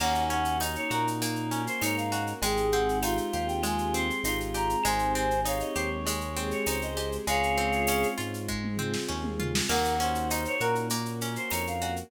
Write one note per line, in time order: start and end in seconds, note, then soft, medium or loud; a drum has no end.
0.00 0.77 D#2 loud
0.00 1.21 A#3 loud
0.00 1.20 A#3 medium
0.00 0.57 C#4 loud
0.00 1.20 C#4 medium
0.00 1.20 D#4 medium
0.00 1.20 F#4 medium
0.00 0.24 F#5 medium
0.00 crash loud
0.00 cowbell loud
0.00 claves loud
0.15 shaker medium
0.30 1.51 C#4 medium
0.30 0.58 F#5 medium
0.30 shaker medium
0.45 shaker medium
0.60 1.62 D#4 medium
0.60 1.82 D#4 medium
0.60 0.76 D#5 medium
0.60 tambourine medium
0.60 cowbell loud
0.60 shaker loud
0.75 0.91 C#5 medium
0.75 shaker medium
0.90 1.68 A#2 medium
0.90 2.11 F#4 medium
0.90 1.06 A#4 medium
0.90 claves loud
0.90 shaker medium
1.07 shaker loud
1.21 2.41 A#3 medium
1.21 2.37 A#3 medium
1.21 2.41 C#4 medium
1.21 2.41 F#4 medium
1.21 2.41 A#4 medium
1.21 cowbell medium
1.21 shaker loud
1.36 shaker medium
1.51 2.38 C#4 medium
1.51 shaker medium
1.67 1.81 C5 medium
1.67 shaker medium
1.81 2.33 G#2 medium
1.81 2.33 D#4 medium
1.81 2.40 D#4 medium
1.81 1.96 C#5 medium
1.81 tambourine medium
1.81 cowbell medium
1.81 claves loud
1.81 shaker loud
1.97 2.25 F5 medium
1.97 shaker medium
2.12 2.41 F#4 medium
2.12 cowbell loud
2.12 shaker loud
2.27 shaker medium
2.42 3.19 G#1 medium
2.42 3.63 G#3 loud
2.42 3.63 G#3 medium
2.42 3.63 C4 medium
2.42 3.63 D#4 medium
2.42 3.63 G4 medium
2.42 2.98 G#4 loud
2.42 2.68 G5 medium
2.42 cowbell loud
2.42 shaker loud
2.57 shaker medium
2.71 3.94 C4 medium
2.71 2.99 F#5 medium
2.71 shaker medium
2.89 shaker medium
3.02 4.24 D#4 medium
3.02 4.07 F4 medium
3.02 3.17 F5 medium
3.02 tambourine medium
3.02 cowbell loud
3.02 claves loud
3.02 shaker loud
3.17 shaker medium
3.32 4.11 D#2 medium
3.32 4.54 G4 medium
3.32 3.47 F5 medium
3.32 shaker medium
3.47 3.62 G5 medium
3.47 shaker medium
3.63 4.79 G#3 medium
3.63 4.83 G#3 medium
3.63 4.83 C4 medium
3.63 4.83 G4 medium
3.63 4.83 G#4 medium
3.63 3.93 G#5 medium
3.63 cowbell loud
3.63 claves loud
3.63 shaker loud
3.78 shaker medium
3.94 4.81 C4 medium
3.94 4.21 C6 medium
3.94 shaker medium
4.10 shaker medium
4.23 4.75 G#1 medium
4.23 4.82 D#4 medium
4.23 4.76 F4 medium
4.23 4.38 C6 medium
4.23 tambourine medium
4.23 cowbell medium
4.23 shaker loud
4.40 shaker medium
4.54 4.83 G4 medium
4.54 4.83 A#5 medium
4.54 cowbell medium
4.54 shaker loud
4.70 shaker medium
4.84 5.63 G#1 medium
4.84 6.06 G#3 loud
4.84 6.05 G#3 medium
4.84 6.05 C4 medium
4.84 6.05 D#4 medium
4.84 6.05 G4 medium
4.84 5.40 C5 loud
4.84 5.12 G#5 medium
4.84 cowbell loud
4.84 claves loud
4.84 shaker loud
4.99 shaker medium
5.15 6.36 C4 medium
5.15 5.41 G#5 medium
5.15 shaker medium
5.31 shaker medium
5.45 6.66 D#4 medium
5.45 6.56 C#5 medium
5.45 5.61 F5 medium
5.45 tambourine medium
5.45 cowbell loud
5.45 shaker loud
5.60 5.75 D#5 medium
5.60 shaker medium
5.75 6.53 D#2 medium
5.75 6.96 G4 medium
5.75 5.90 C5 medium
5.75 claves loud
5.75 shaker loud
6.06 7.26 G#3 loud
6.06 7.22 G#3 medium
6.06 7.26 C4 medium
6.06 7.26 G4 medium
6.06 7.26 G#4 medium
6.06 cowbell medium
6.06 shaker loud
6.21 shaker medium
6.36 7.23 C4 medium
6.36 shaker medium
6.51 6.67 C#5 medium
6.51 shaker medium
6.66 7.18 C#2 medium
6.66 7.24 D#4 medium
6.66 7.16 C5 medium
6.66 6.83 C#5 medium
6.66 tambourine medium
6.66 cowbell medium
6.66 claves medium
6.66 shaker loud
6.82 7.10 D#5 medium
6.82 shaker medium
6.97 7.26 G4 medium
6.97 cowbell medium
6.97 shaker medium
7.12 shaker medium
7.27 8.04 C#2 medium
7.27 8.47 G#3 medium
7.27 8.48 G#3 loud
7.27 8.47 C4 medium
7.27 8.47 C#4 medium
7.27 8.47 F4 medium
7.27 8.07 G#4 loud
7.27 8.07 C#5 medium
7.27 8.07 F5 medium
7.27 cowbell loud
7.27 shaker loud
7.43 shaker medium
7.57 8.78 C4 medium
7.57 shaker medium
7.72 shaker medium
7.87 9.08 C#4 medium
7.87 tambourine loud
7.87 cowbell medium
7.87 claves medium
7.87 shaker loud
8.03 shaker medium
8.18 8.96 G#2 medium
8.18 9.39 F4 medium
8.18 shaker medium
8.34 shaker medium
8.48 9.68 G#3 medium
8.48 9.64 G#3 medium
8.48 9.68 C4 medium
8.48 9.68 F4 medium
8.48 9.68 G#4 medium
8.48 kick medium
8.64 mid tom medium
8.78 9.65 C4 medium
8.78 floor tom medium
8.94 snare loud
9.08 9.61 D#2 medium
9.08 9.66 C#4 medium
9.24 mid tom loud
9.40 9.68 F4 medium
9.40 floor tom loud
9.55 snare loud
9.69 10.47 D#2 medium
9.69 10.89 A#3 medium
9.69 10.90 A#3 loud
9.69 10.89 C#4 medium
9.69 10.89 D#4 medium
9.69 10.89 F#4 medium
9.69 9.94 A#4 loud
9.69 9.98 F#5 medium
9.69 crash loud
9.69 cowbell loud
9.69 claves loud
9.84 shaker medium
9.99 11.21 C#4 medium
9.99 10.55 C5 medium
9.99 10.28 F#5 medium
9.99 shaker loud
10.15 shaker medium
10.30 11.51 D#4 medium
10.30 10.44 D#5 medium
10.30 tambourine medium
10.30 cowbell medium
10.30 shaker loud
10.45 10.61 C#5 medium
10.45 shaker medium
10.60 11.38 A#2 medium
10.60 11.81 F#4 medium
10.60 10.74 A#4 medium
10.60 10.87 A#4 medium
10.60 claves loud
10.60 shaker medium
10.75 shaker medium
10.90 12.06 A#3 loud
10.90 12.11 A#3 medium
10.90 12.11 C#4 medium
10.90 12.11 F#4 medium
10.90 12.11 A#4 medium
10.90 cowbell medium
10.90 shaker loud
11.05 shaker medium
11.21 12.08 C#4 medium
11.21 shaker loud
11.36 11.51 C5 medium
11.36 shaker medium
11.50 12.03 F2 medium
11.50 12.09 D#4 medium
11.50 11.66 C#5 medium
11.50 tambourine medium
11.50 cowbell medium
11.50 claves loud
11.50 shaker loud
11.67 11.95 F5 medium
11.67 shaker medium
11.81 12.10 F#4 medium
11.81 cowbell loud
11.81 shaker medium
11.96 shaker medium